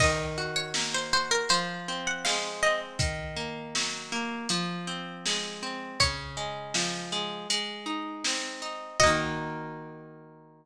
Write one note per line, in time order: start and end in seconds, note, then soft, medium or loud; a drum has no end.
0.00 1.43 D#3 loud
0.00 0.45 D#5 medium
0.00 kick loud
0.00 crash loud
0.38 1.12 F#4 medium
0.56 0.74 C#5 medium
0.74 1.47 A#3 medium
0.74 snare loud
0.94 1.12 C5 medium
1.13 1.49 F#4 medium
1.13 1.31 C5 medium
1.31 1.49 A#4 medium
1.49 2.93 F3 loud
1.49 1.97 C5 medium
1.49 closed hi-hat loud
1.88 2.63 C4 medium
2.07 2.25 F#5 medium
2.25 2.97 G#3 medium
2.25 2.61 F5 medium
2.25 snare loud
2.63 2.99 C4 medium
2.63 2.80 D#5 medium
2.99 4.41 D#3 loud
2.99 kick loud
2.99 closed hi-hat loud
3.36 4.12 A#3 medium
3.75 4.46 F#3 medium
3.75 snare loud
4.12 4.48 A#3 medium
4.49 5.93 F3 medium
4.49 closed hi-hat loud
4.87 5.62 C4 medium
5.26 5.98 G#3 medium
5.26 snare loud
5.63 5.98 C4 medium
6.00 7.42 C#3 loud
6.00 6.93 C#5 medium
6.00 kick loud
6.00 closed hi-hat loud
6.37 7.12 G#3 medium
6.74 7.46 F3 medium
6.74 snare loud
7.12 7.48 G#3 medium
7.50 8.92 G#3 loud
7.50 closed hi-hat loud
7.86 8.61 D#4 medium
8.24 8.98 C4 medium
8.24 snare loud
8.62 8.97 D#4 medium
9.00 10.65 A#3 medium
9.00 10.65 F#4 medium
9.00 10.65 D#5 loud
9.00 kick loud
9.00 crash loud
9.06 10.65 D#3 loud